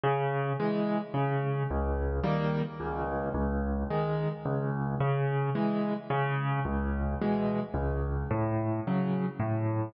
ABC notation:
X:1
M:3/4
L:1/8
Q:1/4=109
K:C#m
V:1 name="Acoustic Grand Piano"
C,2 [E,G,]2 C,2 | C,,2 [D,=G,^A,]2 C,,2 | C,,2 [D,G,]2 C,,2 | C,2 [E,G,]2 C,2 |
C,,2 [B,,E,G,]2 C,,2 | A,,2 [C,F,]2 A,,2 |]